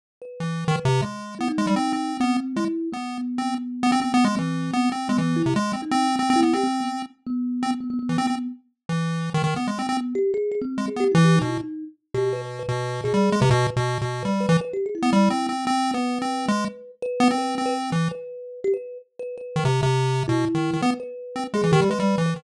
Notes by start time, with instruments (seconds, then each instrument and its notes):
0.22 kalimba B4
0.40 lead 1 (square) E3
0.68 lead 1 (square) D#3
0.75 kalimba B4
0.85 lead 1 (square) C3
1.02 lead 1 (square) G#3
1.39 lead 1 (square) B3, kalimba E4
1.48 kalimba D#4
1.58 lead 1 (square) G#3
1.67 lead 1 (square) G3
1.76 lead 1 (square) C4
1.93 lead 1 (square) C4
2.20 lead 1 (square) B3, kalimba C4
2.56 lead 1 (square) G#3, kalimba E4
2.92 kalimba B3, lead 1 (square) B3
3.38 lead 1 (square) C4
3.83 lead 1 (square) B3
3.92 lead 1 (square) C4
4.01 kalimba B3, lead 1 (square) C4
4.14 lead 1 (square) B3
4.24 lead 1 (square) G#3
4.37 lead 1 (square) E3, kalimba C4
4.73 lead 1 (square) B3
4.92 lead 1 (square) C4
5.09 lead 1 (square) G#3, kalimba B3
5.18 lead 1 (square) E3, kalimba B3
5.36 kalimba E4
5.46 lead 1 (square) C3
5.56 lead 1 (square) G#3
5.73 lead 1 (square) C4
5.82 kalimba D#4
5.91 lead 1 (square) C4
6.19 lead 1 (square) C4
6.30 lead 1 (square) C4
6.36 kalimba E4
6.43 lead 1 (square) B3
6.53 lead 1 (square) C4, kalimba G4
6.63 kalimba C4
6.80 kalimba B3
7.27 kalimba B3
7.63 lead 1 (square) C4
7.80 kalimba B3
7.90 kalimba B3
7.99 kalimba B3
8.09 lead 1 (square) E3
8.18 lead 1 (square) C4
8.27 lead 1 (square) C4
8.89 lead 1 (square) E3
9.34 lead 1 (square) D#3
9.44 lead 1 (square) D#3
9.56 lead 1 (square) B3
9.67 lead 1 (square) G#3
9.79 lead 1 (square) C4
9.89 lead 1 (square) C4
9.97 kalimba B3
10.15 kalimba G4
10.34 kalimba G#4
10.52 kalimba G#4
10.61 kalimba C4
10.78 lead 1 (square) G#3
10.88 kalimba G#4
10.96 lead 1 (square) B3, kalimba G4
11.12 lead 1 (square) E3, kalimba E4
11.24 kalimba G4
11.36 kalimba D#4
11.41 lead 1 (square) B2
11.48 kalimba E4
11.60 kalimba D#4
12.14 lead 1 (square) B2, kalimba G4
12.33 kalimba B4
12.42 kalimba B4
12.59 kalimba B4
12.68 lead 1 (square) B2
13.04 lead 1 (square) B2, kalimba G#4
13.14 lead 1 (square) G3
13.32 lead 1 (square) G#3
13.41 lead 1 (square) C3, kalimba B4
13.50 lead 1 (square) B2
13.76 lead 1 (square) B2
14.01 lead 1 (square) B2
14.22 lead 1 (square) G3, kalimba B4
14.40 kalimba B4
14.49 lead 1 (square) E3, kalimba B4
14.61 kalimba B4
14.73 kalimba G4
14.86 kalimba G#4
14.95 kalimba E4
15.02 lead 1 (square) B3
15.13 lead 1 (square) G3
15.30 lead 1 (square) C4
15.49 lead 1 (square) C4
15.67 lead 1 (square) C4
15.94 lead 1 (square) B3, kalimba B4
16.22 lead 1 (square) C4
16.48 lead 1 (square) G#3
17.02 kalimba B4
17.20 lead 1 (square) B3
17.31 lead 1 (square) C4
17.38 kalimba B4
17.58 lead 1 (square) C4
17.66 kalimba B4
17.92 lead 1 (square) E3
18.11 kalimba B4
18.64 kalimba G4
18.74 kalimba B4
19.19 kalimba B4
19.38 kalimba B4
19.56 lead 1 (square) D#3
19.65 lead 1 (square) C3
19.83 lead 1 (square) C3
20.28 lead 1 (square) B2, kalimba E4
20.55 lead 1 (square) D#3
20.73 lead 1 (square) D#3
20.82 lead 1 (square) B3, kalimba B4
21.00 kalimba B4
21.36 lead 1 (square) C4
21.54 lead 1 (square) G#3, kalimba G#4
21.63 lead 1 (square) E3
21.72 lead 1 (square) D#3, kalimba G4
21.81 lead 1 (square) G3
21.90 lead 1 (square) G#3, kalimba B4
22.00 lead 1 (square) G3
22.18 lead 1 (square) E3
22.26 kalimba B4
22.36 lead 1 (square) D#3